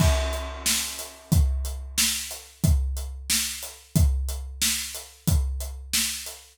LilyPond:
\new DrumStaff \drummode { \time 6/8 \tempo 4. = 91 <cymc bd>8. hh8. sn8. hh8. | <hh bd>8. hh8. sn8. hh8. | <hh bd>8. hh8. sn8. hh8. | <hh bd>8. hh8. sn8. hh8. |
<hh bd>8. hh8. sn8. hh8. | }